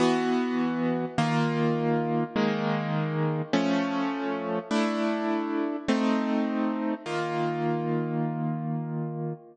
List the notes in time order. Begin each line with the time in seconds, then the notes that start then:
0.00 E3 B3 F#4
1.18 D#3 A#3 F4
2.36 D#3 G#3 A#3
3.53 F3 A3 C#4
4.71 A3 D4 E4
5.88 A3 C4 D#4
7.06 D#3 A#3 F4